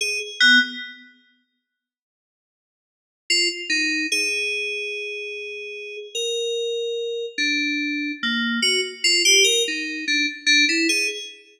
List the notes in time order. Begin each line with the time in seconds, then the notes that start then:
0.01 G#4
0.40 B3
3.30 F4
3.70 D#4
4.12 G#4
6.15 A#4
7.38 D4
8.23 A#3
8.62 F#4
9.04 F4
9.25 G4
9.44 A#4
9.68 D#4
10.08 D4
10.47 D4
10.69 E4
10.89 G#4